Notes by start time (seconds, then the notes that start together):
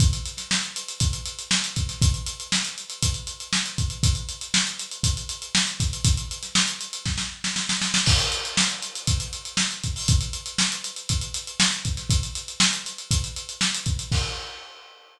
0.00 kick, closed hi-hat
0.13 closed hi-hat
0.26 closed hi-hat
0.37 snare, closed hi-hat
0.51 snare
0.63 closed hi-hat
0.76 closed hi-hat
0.88 closed hi-hat
1.00 kick, closed hi-hat
1.13 closed hi-hat
1.26 closed hi-hat
1.39 closed hi-hat
1.51 snare
1.64 closed hi-hat
1.76 kick, closed hi-hat
1.89 snare, closed hi-hat
2.02 kick, closed hi-hat
2.14 closed hi-hat
2.26 closed hi-hat
2.40 closed hi-hat
2.52 snare
2.65 snare, closed hi-hat
2.78 closed hi-hat
2.90 closed hi-hat
3.03 kick, closed hi-hat
3.14 closed hi-hat
3.27 closed hi-hat
3.40 closed hi-hat
3.53 snare
3.66 closed hi-hat
3.78 kick, closed hi-hat
3.90 closed hi-hat
4.03 kick, closed hi-hat
4.15 closed hi-hat
4.29 closed hi-hat
4.41 closed hi-hat
4.54 snare
4.67 closed hi-hat
4.79 closed hi-hat
4.91 closed hi-hat
5.03 kick, closed hi-hat
5.17 closed hi-hat
5.29 closed hi-hat
5.42 closed hi-hat
5.55 snare
5.67 closed hi-hat
5.79 kick, snare, closed hi-hat
5.93 closed hi-hat
6.05 kick, closed hi-hat
6.17 closed hi-hat
6.31 closed hi-hat
6.43 snare, closed hi-hat
6.55 snare
6.68 closed hi-hat
6.81 closed hi-hat
6.93 closed hi-hat
7.05 kick, snare
7.18 snare
7.44 snare
7.56 snare
7.69 snare
7.82 snare
7.94 snare
8.06 kick, crash
8.19 closed hi-hat
8.32 closed hi-hat
8.45 closed hi-hat
8.57 snare
8.69 closed hi-hat
8.82 closed hi-hat
8.95 closed hi-hat
9.07 kick, closed hi-hat
9.20 closed hi-hat
9.33 closed hi-hat
9.45 closed hi-hat
9.57 snare
9.71 closed hi-hat
9.84 kick, closed hi-hat
9.96 open hi-hat
10.08 kick, closed hi-hat
10.21 closed hi-hat
10.33 closed hi-hat
10.46 closed hi-hat
10.58 snare
10.72 closed hi-hat
10.84 closed hi-hat
10.96 closed hi-hat
11.09 kick, closed hi-hat
11.21 closed hi-hat
11.34 closed hi-hat
11.47 closed hi-hat
11.60 snare
11.72 closed hi-hat
11.85 kick, closed hi-hat
11.97 snare, closed hi-hat
12.10 kick, closed hi-hat
12.23 closed hi-hat
12.35 closed hi-hat
12.48 closed hi-hat
12.60 snare
12.73 closed hi-hat
12.85 snare, closed hi-hat
12.98 closed hi-hat
13.11 kick, closed hi-hat
13.24 closed hi-hat
13.36 closed hi-hat
13.49 closed hi-hat
13.61 snare
13.74 closed hi-hat
13.86 kick, closed hi-hat
13.99 closed hi-hat
14.12 kick, crash